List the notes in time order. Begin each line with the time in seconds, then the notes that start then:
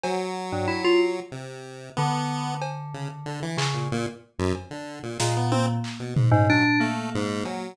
0.03 F#3, cowbell
0.52 G2
0.68 E4
0.84 F4
1.32 C3
1.97 D3 B3
2.62 cowbell
2.94 C#3
3.26 D3
3.42 E3
3.57 C#3, clap
3.74 A#2
3.92 A#2
4.39 F#2
4.55 cowbell
4.71 D3
5.03 A#2
5.19 A#2 G#3, snare
5.37 B3
5.52 C4, high tom
5.84 clap
6.00 B2
6.16 G#2, floor tom
6.31 G#2 C#3
6.49 F#3 D4, floor tom
6.80 A3 A#3
7.15 G#2
7.45 F#3, cowbell